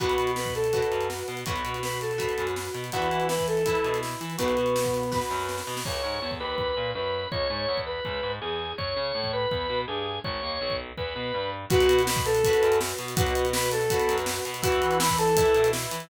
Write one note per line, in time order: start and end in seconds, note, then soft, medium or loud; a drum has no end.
0.00 0.16 B1 medium
0.00 0.31 F#4 loud
0.00 0.65 F#4 medium
0.00 0.65 B4 medium
0.00 0.31 F#5 loud
0.00 kick medium
0.00 closed hi-hat medium
0.09 closed hi-hat medium
0.18 0.80 B2 medium
0.18 closed hi-hat medium
0.27 closed hi-hat medium
0.36 0.54 B4 medium
0.36 0.54 B5 medium
0.36 snare medium
0.46 kick medium
0.46 closed hi-hat medium
0.55 1.08 A4 medium
0.55 1.08 A5 medium
0.55 closed hi-hat medium
0.64 closed hi-hat medium
0.73 1.39 F#4 medium
0.73 1.39 B4 medium
0.73 kick medium
0.73 closed hi-hat medium
0.82 closed hi-hat medium
0.91 1.23 F#2 medium
0.91 closed hi-hat medium
1.01 closed hi-hat medium
1.10 snare medium
1.19 closed hi-hat medium
1.28 1.44 B2 medium
1.28 closed hi-hat medium
1.37 closed hi-hat medium
1.46 1.62 B1 medium
1.46 2.12 F#4 medium
1.46 1.76 F#4 medium
1.46 2.12 B4 medium
1.46 1.76 F#5 medium
1.46 kick loud
1.46 closed hi-hat medium
1.56 closed hi-hat medium
1.65 2.27 B2 medium
1.65 closed hi-hat medium
1.74 closed hi-hat medium
1.83 1.99 B4 medium
1.83 1.99 B5 medium
1.83 snare medium
1.92 closed hi-hat medium
2.01 2.46 A4 medium
2.01 2.46 A5 medium
2.01 closed hi-hat medium
2.11 closed hi-hat medium
2.18 2.84 F#4 medium
2.18 2.84 B4 medium
2.18 kick medium
2.18 closed hi-hat medium
2.29 closed hi-hat medium
2.38 2.69 F#2 medium
2.38 closed hi-hat medium
2.47 closed hi-hat medium
2.56 snare medium
2.65 closed hi-hat medium
2.74 2.90 B2 medium
2.74 closed hi-hat medium
2.84 closed hi-hat medium
2.92 3.08 E2 medium
2.92 3.59 E4 medium
2.92 3.27 F#4 loud
2.92 3.59 B4 medium
2.92 3.27 F#5 loud
2.92 kick medium
2.92 closed hi-hat medium
3.02 closed hi-hat medium
3.11 3.73 E3 medium
3.11 closed hi-hat medium
3.20 closed hi-hat medium
3.29 3.46 B4 medium
3.29 3.46 B5 medium
3.29 snare loud
3.39 kick medium
3.39 closed hi-hat medium
3.48 3.99 A4 medium
3.48 3.99 A5 loud
3.48 closed hi-hat medium
3.57 closed hi-hat medium
3.66 4.32 E4 medium
3.66 4.32 B4 medium
3.66 kick medium
3.66 closed hi-hat medium
3.75 closed hi-hat medium
3.84 4.15 B2 medium
3.84 closed hi-hat medium
3.94 closed hi-hat medium
4.03 snare medium
4.11 closed hi-hat medium
4.21 4.36 E3 medium
4.21 closed hi-hat medium
4.30 closed hi-hat medium
4.38 4.55 B1 medium
4.38 5.18 B3 medium
4.38 5.04 F#4 medium
4.38 5.18 B4 loud
4.38 5.04 B4 medium
4.38 kick medium
4.38 closed hi-hat loud
4.48 closed hi-hat medium
4.57 5.20 B2 medium
4.57 closed hi-hat medium
4.66 closed hi-hat medium
4.76 snare loud
4.85 kick medium
4.85 closed hi-hat medium
4.94 closed hi-hat medium
5.03 closed hi-hat medium
5.12 5.78 F#4 medium
5.12 5.78 B4 medium
5.12 kick medium
5.12 snare medium
5.21 snare medium
5.30 5.62 F#2 medium
5.30 snare medium
5.39 snare medium
5.49 snare medium
5.58 snare medium
5.67 5.83 B2 medium
5.67 snare medium
5.77 snare medium
5.85 6.01 C#2 medium
5.85 6.31 C#5 medium
5.85 kick medium
5.85 crash medium
6.04 6.19 G#2 medium
6.22 6.39 E2 medium
6.31 kick medium
6.40 6.74 D#2 medium
6.40 6.91 B4 medium
6.58 kick medium
6.77 6.92 A#2 medium
6.95 7.26 F#2 medium
6.95 7.27 B4 medium
7.32 7.47 C#2 medium
7.32 7.79 C#5 loud
7.32 kick medium
7.50 7.66 G#2 medium
7.68 7.99 E2 medium
7.77 kick medium
7.87 8.32 B4 medium
8.05 8.20 C#2 medium
8.05 kick medium
8.23 8.39 G#2 medium
8.41 8.73 E2 medium
8.41 8.73 G#4 medium
8.78 8.94 F#2 medium
8.78 9.32 C#5 medium
8.78 kick medium
8.96 9.12 C#3 medium
9.15 9.46 A2 medium
9.24 kick medium
9.33 9.79 B4 medium
9.51 9.67 E2 medium
9.51 kick medium
9.70 9.85 B2 medium
9.88 10.19 G2 medium
9.88 10.18 G#4 medium
10.24 10.40 G#1 medium
10.24 10.75 C#5 loud
10.24 kick medium
10.43 10.58 D#2 medium
10.61 10.92 B1 medium
10.70 kick medium
10.97 11.13 E2 medium
10.97 11.50 B4 medium
10.97 kick medium
11.16 11.31 B2 medium
11.34 11.65 G2 medium
11.70 11.86 B1 loud
11.70 12.36 F#4 loud
11.70 12.02 F#4 loud
11.70 12.36 B4 loud
11.70 12.02 F#5 loud
11.70 kick loud
11.70 closed hi-hat loud
11.80 closed hi-hat medium
11.89 12.51 B2 medium
11.89 closed hi-hat medium
11.99 closed hi-hat medium
12.07 12.25 B4 loud
12.07 12.25 B5 loud
12.07 snare loud
12.16 kick loud
12.16 closed hi-hat medium
12.26 12.78 A4 loud
12.26 12.78 A5 loud
12.26 closed hi-hat medium
12.35 closed hi-hat medium
12.44 13.11 F#4 medium
12.44 13.11 B4 medium
12.44 kick medium
12.44 closed hi-hat loud
12.53 closed hi-hat medium
12.62 12.93 F#2 medium
12.62 closed hi-hat medium
12.72 closed hi-hat medium
12.81 snare loud
12.89 closed hi-hat medium
12.99 13.14 B2 medium
12.99 closed hi-hat medium
13.08 closed hi-hat medium
13.16 13.33 B1 medium
13.16 13.82 F#4 loud
13.16 13.46 F#4 loud
13.16 13.82 B4 loud
13.16 13.46 F#5 loud
13.16 kick loud
13.16 closed hi-hat loud
13.27 closed hi-hat medium
13.35 13.98 B2 medium
13.35 closed hi-hat medium
13.45 closed hi-hat medium
13.53 13.69 B4 loud
13.53 13.69 B5 loud
13.53 snare loud
13.63 closed hi-hat medium
13.71 14.16 A4 loud
13.71 14.16 A5 loud
13.71 closed hi-hat medium
13.81 closed hi-hat medium
13.90 14.57 F#4 medium
13.90 14.57 B4 medium
13.90 kick medium
13.90 closed hi-hat loud
14.00 closed hi-hat medium
14.09 14.40 F#2 medium
14.09 closed hi-hat medium
14.18 closed hi-hat medium
14.26 snare loud
14.36 closed hi-hat medium
14.45 14.61 B2 medium
14.45 closed hi-hat medium
14.54 closed hi-hat medium
14.62 14.79 E2 loud
14.62 15.28 E4 loud
14.62 14.98 F#4 loud
14.62 15.28 B4 loud
14.62 14.98 F#5 loud
14.62 kick loud
14.62 closed hi-hat loud
14.72 closed hi-hat medium
14.82 15.44 E3 medium
14.82 closed hi-hat medium
14.91 closed hi-hat medium
15.00 15.17 B4 loud
15.00 15.17 B5 loud
15.00 snare loud
15.09 kick medium
15.09 closed hi-hat medium
15.18 15.69 A4 loud
15.18 15.69 A5 loud
15.18 closed hi-hat medium
15.28 closed hi-hat medium
15.37 16.03 E4 loud
15.37 16.03 B4 medium
15.37 kick loud
15.37 closed hi-hat loud
15.46 closed hi-hat medium
15.54 15.86 B2 medium
15.54 closed hi-hat medium
15.64 closed hi-hat medium
15.73 snare loud
15.82 closed hi-hat medium
15.91 16.07 E3 medium
15.91 closed hi-hat medium
16.00 closed hi-hat medium